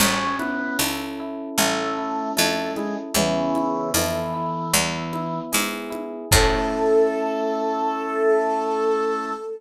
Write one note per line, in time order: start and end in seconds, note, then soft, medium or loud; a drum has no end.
0.00 0.70 A1 medium
0.00 0.35 C#4 medium
0.00 1.58 C#4 loud
0.00 crash loud
0.00 cowbell medium
0.00 low conga loud
0.39 0.77 B3 medium
0.39 1.19 E4 medium
0.39 high conga medium
0.79 1.50 C#2 medium
0.79 2.37 A4 medium
0.79 tambourine medium
0.79 cowbell medium
0.79 high conga medium
1.20 1.97 E4 medium
1.58 2.29 A1 medium
1.58 2.31 A3 medium
1.58 3.09 C#4 medium
1.58 cowbell medium
1.58 low conga medium
1.98 2.77 E4 medium
2.37 3.09 F2 medium
2.37 2.71 A3 medium
2.37 3.12 A4 medium
2.37 tambourine medium
2.37 cowbell medium
2.37 high conga medium
2.76 2.95 G#3 medium
2.76 3.15 E4 medium
2.76 high conga medium
3.14 3.85 E2 medium
3.14 3.90 C#3 medium
3.14 3.90 E3 medium
3.14 4.66 B3 loud
3.14 cowbell medium
3.14 low conga loud
3.55 4.33 E4 medium
3.55 high conga medium
3.94 4.65 F2 medium
3.94 5.39 E3 medium
3.94 4.71 A4 medium
3.94 tambourine medium
3.94 cowbell medium
3.94 high conga medium
4.34 4.71 E4 medium
4.73 5.45 E2 loud
4.73 6.23 B3 medium
4.73 cowbell medium
4.73 low conga medium
5.13 5.90 E4 medium
5.13 high conga medium
5.52 6.25 G#2 medium
5.52 6.28 G#4 medium
5.52 tambourine medium
5.52 cowbell medium
5.52 high conga medium
5.90 6.28 E4 medium
5.90 high conga medium
6.31 9.31 A2 loud
6.31 9.31 A3 loud
6.31 9.31 C#4 loud
6.31 9.31 E4 loud
6.31 9.31 A4 loud
6.31 kick loud
6.31 crash loud